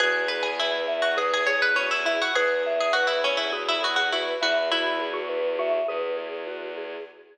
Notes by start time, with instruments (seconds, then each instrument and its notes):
0.00 violin E2, vibraphone F#4, pizzicato strings G#4, xylophone B4
0.28 vibraphone G#4, pizzicato strings B4
0.43 pizzicato strings G#4
0.60 pizzicato strings E4, vibraphone B4
0.87 vibraphone E5
1.02 pizzicato strings F#4
1.17 xylophone G#4, pizzicato strings G#4, vibraphone B4
1.34 pizzicato strings G#4
1.47 xylophone G#4, vibraphone G#4, pizzicato strings C#5
1.62 pizzicato strings B4
1.75 pizzicato strings C#4, vibraphone F#4, xylophone F#4
1.91 pizzicato strings E4
2.05 xylophone E4, pizzicato strings E4, vibraphone G#4
2.22 pizzicato strings F#4
2.35 violin E2, pizzicato strings G#4, vibraphone B4, xylophone B4
2.66 vibraphone E5
2.81 pizzicato strings G#4
2.93 pizzicato strings F#4, vibraphone B4
3.07 pizzicato strings E4
3.24 pizzicato strings C#4, vibraphone G#4
3.37 pizzicato strings E4
3.52 vibraphone F#4, xylophone G#4
3.69 pizzicato strings E4
3.83 pizzicato strings F#4, xylophone G#4, vibraphone G#4
3.96 pizzicato strings F#4
4.12 pizzicato strings E4, xylophone F#4, vibraphone B4
4.41 violin E2, xylophone E4, pizzicato strings F#4, vibraphone E5
4.72 xylophone E4, pizzicato strings E4, vibraphone F#4
5.00 vibraphone G#4
5.14 xylophone F#4
5.29 vibraphone B4
5.59 xylophone F#4, vibraphone E5
5.88 violin E2, xylophone G#4, vibraphone B4
6.17 vibraphone G#4
6.47 vibraphone F#4
6.77 vibraphone G#4